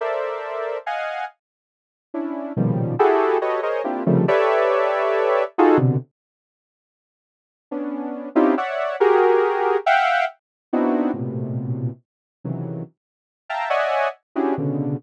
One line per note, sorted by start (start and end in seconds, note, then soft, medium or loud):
0.01 0.78 A4 medium
0.01 0.78 A#4 medium
0.01 0.78 C5 medium
0.01 0.78 D5 medium
0.01 0.78 E5 medium
0.86 1.25 D#5 medium
0.86 1.25 F5 medium
0.86 1.25 F#5 medium
0.86 1.25 G#5 medium
2.14 2.53 C#4 medium
2.14 2.53 D4 medium
2.14 2.53 E4 medium
2.57 2.95 A#2 medium
2.57 2.95 B2 medium
2.57 2.95 C#3 medium
2.57 2.95 D#3 medium
2.57 2.95 F3 medium
2.57 2.95 G3 medium
2.99 3.38 E4 loud
2.99 3.38 F#4 loud
2.99 3.38 G4 loud
2.99 3.38 G#4 loud
2.99 3.38 A4 loud
3.41 3.61 F#4 medium
3.41 3.61 G4 medium
3.41 3.61 A4 medium
3.41 3.61 B4 medium
3.41 3.61 C#5 medium
3.41 3.61 D#5 medium
3.63 3.82 G#4 medium
3.63 3.82 A#4 medium
3.63 3.82 C5 medium
3.63 3.82 C#5 medium
3.63 3.82 D#5 medium
3.84 4.03 A#3 medium
3.84 4.03 C4 medium
3.84 4.03 D4 medium
3.84 4.03 E4 medium
3.84 4.03 F4 medium
3.84 4.03 G4 medium
4.06 4.25 C3 loud
4.06 4.25 C#3 loud
4.06 4.25 D#3 loud
4.06 4.25 F3 loud
4.06 4.25 G3 loud
4.06 4.25 A3 loud
4.28 5.44 G4 medium
4.28 5.44 A4 medium
4.28 5.44 B4 medium
4.28 5.44 C#5 medium
4.28 5.44 D5 medium
4.28 5.44 E5 medium
5.58 5.78 D#4 loud
5.58 5.78 F4 loud
5.58 5.78 F#4 loud
5.58 5.78 G#4 loud
5.58 5.78 A4 loud
5.78 5.97 B2 loud
5.78 5.97 C3 loud
5.78 5.97 D3 loud
7.71 8.29 B3 medium
7.71 8.29 C#4 medium
7.71 8.29 D4 medium
8.35 8.55 C4 loud
8.35 8.55 C#4 loud
8.35 8.55 D#4 loud
8.35 8.55 E4 loud
8.35 8.55 F4 loud
8.35 8.55 G4 loud
8.58 8.96 C#5 medium
8.58 8.96 D5 medium
8.58 8.96 E5 medium
8.58 8.96 F#5 medium
9.00 9.77 F#4 loud
9.00 9.77 G4 loud
9.00 9.77 G#4 loud
9.00 9.77 A#4 loud
9.86 10.25 E5 loud
9.86 10.25 F5 loud
9.86 10.25 F#5 loud
9.86 10.25 G5 loud
10.73 11.11 B3 medium
10.73 11.11 C4 medium
10.73 11.11 D4 medium
10.73 11.11 D#4 medium
10.73 11.11 E4 medium
10.73 11.11 F#4 medium
11.14 11.91 A2 medium
11.14 11.91 A#2 medium
11.14 11.91 B2 medium
11.14 11.91 C3 medium
12.44 12.83 C3 medium
12.44 12.83 C#3 medium
12.44 12.83 D#3 medium
12.44 12.83 E3 medium
12.44 12.83 F#3 medium
13.49 13.69 E5 medium
13.49 13.69 F5 medium
13.49 13.69 G5 medium
13.49 13.69 A5 medium
13.49 13.69 A#5 medium
13.70 14.08 C#5 medium
13.70 14.08 D5 medium
13.70 14.08 D#5 medium
13.70 14.08 E5 medium
13.70 14.08 F#5 medium
13.70 14.08 G#5 medium
14.36 14.55 C#4 medium
14.36 14.55 D4 medium
14.36 14.55 E4 medium
14.36 14.55 F#4 medium
14.36 14.55 G4 medium
14.36 14.55 G#4 medium
14.58 14.96 B2 medium
14.58 14.96 C#3 medium
14.58 14.96 D3 medium